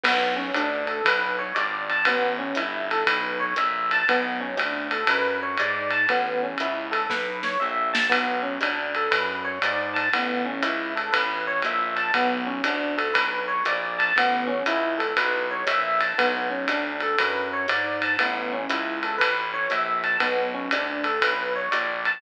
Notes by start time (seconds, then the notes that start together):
0.03 B1 B3, kick, crash, ride
0.36 C#4
0.54 D2 D4, hi-hat pedal, ride
0.87 A4, ride
1.05 B1 B4, kick, ride
1.39 C#5
1.55 G#1 D5, hi-hat pedal, ride
1.90 A5, ride
2.05 A1 B3, kick, ride
2.39 C#4
2.55 G1 E4, hi-hat pedal, ride
2.91 A4, ride
3.07 B1 B4, kick, ride
3.40 C#5
3.56 A#1 E5, hi-hat pedal, ride
3.91 A5, ride
4.08 B1 B3, kick, ride
4.41 C#4
4.56 D2 D4, hi-hat pedal, ride
4.91 A4, ride
5.07 F#2 B4, kick, ride
5.43 C#5
5.57 G#2 D5, hi-hat pedal, ride
5.91 A5, ride
6.09 A1 B3, kick, ride
6.43 C#4
6.58 C#2 E4, hi-hat pedal, ride
6.91 A4, ride
7.10 B1 B4, kick, snare
7.43 C#5, snare
7.60 A#1 E5
7.93 A5, snare
8.09 B1 B3, kick, ride
8.43 C#4
8.61 D2 D4, hi-hat pedal, ride
8.95 A4, ride
9.11 F#2 B4, kick, ride
9.44 C#5
9.62 G#2 D5, hi-hat pedal, ride
9.94 A5, ride
10.13 A1 B3, kick, ride
10.45 C#4
10.63 C#2 E4, hi-hat pedal, ride
10.96 A4, ride
11.12 A1 B4, kick, ride
11.47 C#5
11.62 A#1 E5, hi-hat pedal, ride
11.96 A5, ride
12.14 B1 B3, kick, ride
12.47 C#4
12.64 D2 D4, hi-hat pedal, ride
12.97 A4, ride
13.14 B1 B4, kick, ride
13.48 C#5
13.65 A#1 D5, hi-hat pedal, ride
13.99 A5, ride
14.16 A1 B3, kick, ride
14.47 C#4
14.66 C#2 E4, hi-hat pedal, ride
14.98 A4, ride
15.16 B1 B4, kick, ride
15.51 C#5
15.67 A#1 E5, hi-hat pedal, ride
16.01 A5, ride
16.18 B1 B3, kick, ride
16.50 C#4
16.68 D2 D4, hi-hat pedal, ride
17.00 A4, ride
17.18 F#2 B4, kick, ride
17.53 C#5
17.68 G#2 D5, hi-hat pedal, ride
18.02 A5, ride
18.19 A1 B3, kick, ride
18.53 C#4
18.69 C#2 E4, hi-hat pedal, ride
19.03 A4, ride
19.18 A1 B4, kick, ride
19.54 C#5
19.70 A#1 E5, hi-hat pedal, ride
20.04 A5, ride
20.20 B1 B3, kick, ride
20.54 C#4
20.71 D2 D4, hi-hat pedal, ride
21.04 A4, ride
21.21 B1 B4, kick, ride
21.56 C#5
21.71 A#1 D5, hi-hat pedal, ride
22.05 A5, ride